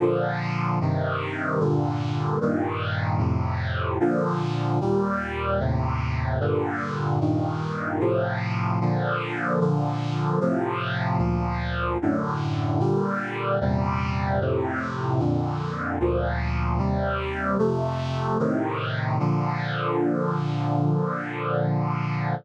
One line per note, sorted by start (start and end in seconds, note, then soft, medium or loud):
0.00 0.80 A#2 medium
0.00 0.80 D3 loud
0.00 0.80 F3 loud
0.81 1.59 G2 medium
0.81 1.60 C3 loud
0.81 1.60 D#3 loud
1.60 2.39 G2 loud
1.60 2.39 A#2 loud
1.60 2.39 D3 loud
2.41 3.20 G2 loud
2.41 3.20 A#2 loud
2.41 3.20 D#3 loud
3.19 3.98 F2 loud
3.19 3.98 A2 loud
3.19 3.98 C3 medium
4.00 4.79 A#2 loud
4.00 4.79 D3 loud
4.00 4.79 F3 loud
4.81 5.59 D#2 medium
4.81 5.60 A#2 loud
4.81 5.60 G3 loud
5.60 6.39 D#2 medium
5.60 6.39 A2 loud
5.60 6.39 C3 loud
6.40 7.19 G2 loud
6.40 7.19 A#2 loud
6.40 7.19 D3 loud
7.21 8.00 G2 loud
7.21 8.00 A#2 medium
7.21 8.00 D#3 medium
8.00 8.79 A2 loud
8.00 8.79 C3 medium
8.00 8.79 F3 loud
8.81 9.60 A#2 loud
8.81 9.60 D3 loud
8.81 9.60 F3 loud
9.60 10.40 A#2 loud
9.60 10.40 D3 loud
9.60 10.40 F3 medium
10.41 11.20 A2 loud
10.41 11.20 C3 loud
10.41 11.18 F3 loud
11.18 11.98 D2 medium
11.18 11.98 A#2 medium
11.18 11.98 F3 loud
12.02 12.81 F#2 medium
12.02 12.81 A2 loud
12.02 12.79 D3 loud
12.80 13.59 A#2 loud
12.80 13.59 D3 medium
12.80 13.59 G3 loud
13.61 14.40 E2 medium
13.61 14.40 A#2 medium
13.61 14.40 C3 loud
13.61 14.40 G3 loud
14.41 15.19 F2 medium
14.41 15.20 A2 loud
14.41 15.20 C3 loud
15.19 15.98 F2 loud
15.19 15.98 A#2 medium
15.19 15.98 D3 medium
16.00 16.79 D2 loud
16.00 16.79 A#2 loud
16.00 16.79 F3 medium
16.78 17.57 D#2 medium
16.78 17.57 C3 medium
16.78 17.57 G3 loud
17.59 18.38 F2 loud
17.59 18.38 C3 loud
17.59 18.38 A3 loud
18.39 19.18 A2 loud
18.39 19.18 C3 loud
18.39 19.18 D#3 loud
19.19 22.35 A#2 medium
19.19 22.35 D3 loud
19.19 22.35 F3 medium